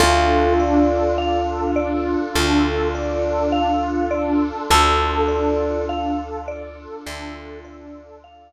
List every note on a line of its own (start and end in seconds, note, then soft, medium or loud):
0.00 2.16 D2 medium
0.00 4.65 D4 medium
0.00 4.39 F4 loud
0.00 4.65 F4 medium
0.00 0.53 A4 medium
0.00 4.65 A4 medium
0.60 1.13 D5 medium
1.18 1.71 F5 medium
1.76 2.29 D5 medium
2.36 4.52 D2 medium
2.36 2.88 A4 medium
2.95 3.48 D5 medium
3.52 4.05 F5 medium
4.11 4.64 D5 medium
4.70 6.87 D2 medium
4.70 8.52 D4 medium
4.70 8.52 F4 medium
4.70 8.52 A4 medium
4.70 5.23 A4 medium
4.70 5.85 A4 loud
5.28 5.81 D5 medium
5.89 6.42 F5 medium
6.48 7.01 D5 medium
7.06 8.52 D2 medium
7.06 7.59 A4 medium
7.64 8.17 D5 medium
8.24 8.52 F5 medium